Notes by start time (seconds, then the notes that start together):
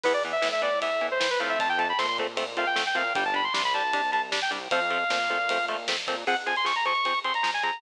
0.03 E2 E3 B3 B4, kick, crash
0.14 D5
0.24 E3 B3, ride
0.32 E5
0.42 A2 E3 B3, snare
0.52 E5
0.62 E3 B3 D5, kick, ride
0.82 E3 B3 E5, kick, ride
1.01 E3 B3, ride
1.11 C5
1.20 E3 B3 C5, snare
1.31 B4
1.40 A2 F3 A3 C4 F5, ride
1.49 E5
1.59 F2 A5, kick, ride
1.69 G5
1.78 F3 A3 C4 A5, ride
1.89 B5
1.99 A#2 F3 A3 C4 C6, snare
2.08 C6
2.18 F3 A3 C4, kick, ride
2.37 F3 A3 C4, kick, ride
2.57 F3 A3 C4 F5, ride
2.67 G5
2.76 F3 A3 C4, snare
2.86 G5
2.95 A#2 F3 A3 C4 F5, kick, ride
3.15 G1 G3 D4 G5, kick, ride
3.25 A5
3.34 G3 D4 B5, ride
3.44 C6
3.54 C2 G3 D4 C6, snare
3.64 B5
3.74 G3 D4 A5, ride
3.93 G3 D4, kick, ride
4.12 G3 D4 A5, ride
4.32 G3 D4, snare
4.42 G5
4.51 C2 G3 D4, kick, ride
4.71 F2 F3 A3 C4 F5, kick, ride
4.90 F3 A3 C4, ride
5.10 A#2 F3 A3 C4, snare
5.29 F3 A3 C4, kick, ride
5.49 F3 A3 C4, kick, ride
5.68 F3 A3 C4, ride
5.88 F3 A3 C4, snare
6.07 A#2 F3 A3 C4, kick, ride
6.27 F3 C4 G#4 F#5, kick, crash
6.37 ride
6.46 F3 C4 G#4 G#5, ride
6.56 C6, ride
6.65 F3 C4 G#4 C#6, snare
6.76 A#5, ride
6.85 F3 C4 G#4 C#6, ride
6.95 ride
7.05 F3 C4 G#4, kick, ride
7.15 ride
7.24 F3 C4 G#4 C6, ride
7.34 A#5, ride
7.43 F3 C4 G#4, snare
7.54 G#5, ride
7.63 F3 C4 G#4 A#5, kick, ride
7.73 ride